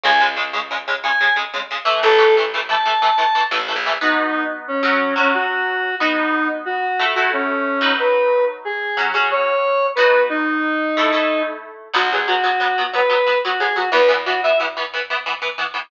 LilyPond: <<
  \new Staff \with { instrumentName = "Lead 1 (square)" } { \time 12/8 \key b \mixolydian \tempo 4. = 121 gis''8 r2 r8 gis''4 r2 | a'4 r4 a''2~ a''8 r4. | dis'4. r8 cis'4. cis'8 fis'2 | dis'4. r8 fis'4. fis'8 cis'2 |
b'4. r8 gis'4. gis'8 cis''2 | b'4 dis'1 r4 | fis'8 gis'8 fis'2 b'4. fis'8 gis'8 fis'8 | b'8 r8 fis'8 e''8 r1 | }
  \new Staff \with { instrumentName = "Overdriven Guitar" } { \time 12/8 \key b \mixolydian <cis gis>8 <cis gis>8 <cis gis>8 <cis gis>8 <cis gis>8 <cis gis>8 <cis gis>8 <cis gis>8 <cis gis>8 <cis gis>8 <cis gis>8 <e a>8~ | <e a>8 <e a>8 <e a>8 <e a>8 <e a>8 <e a>8 <e a>8 <e a>8 <e a>8 <e a>8 <e a>8 <e a>8 | <b dis' fis'>2~ <b dis' fis'>8 <fis cis' fis'>4 <fis cis' fis'>2~ <fis cis' fis'>8 | <b dis' fis'>2. <a e' a'>8 <a e' a'>2 <fis dis' b'>8~ |
<fis dis' b'>2. <fis cis' fis'>8 <fis cis' fis'>2~ <fis cis' fis'>8 | <b dis' fis'>2. <a e' a'>8 <a e' a'>2~ <a e' a'>8 | <fis b>8 <fis b>8 <fis b>8 <fis b>8 <fis b>8 <fis b>8 <fis b>8 <fis b>8 <fis b>8 <fis b>8 <fis b>8 <fis b>8 | <e b>8 <e b>8 <e b>8 <e b>8 <e b>8 <e b>8 <e b>8 <e b>8 <e b>8 <e b>8 <e b>8 <e b>8 | }
  \new Staff \with { instrumentName = "Electric Bass (finger)" } { \clef bass \time 12/8 \key b \mixolydian cis,1. | a,,1~ a,,8 a,,8. ais,,8. | r1. | r1. |
r1. | r1. | b,,1. | e,1. | }
>>